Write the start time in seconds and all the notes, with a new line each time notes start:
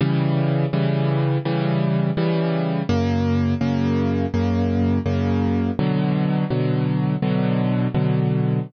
0.01 C#3 E3 G3
0.73 C#3 E3 G3
1.45 C#3 E3 G3
2.17 C#3 E3 G3
2.89 F#2 C#3 A#3
3.61 F#2 C#3 A#3
4.34 F#2 C#3 A#3
5.06 F#2 C#3 A#3
5.79 B2 D3 F#3
6.50 B2 D3 F#3
7.22 B2 D3 F#3
7.94 B2 D3 F#3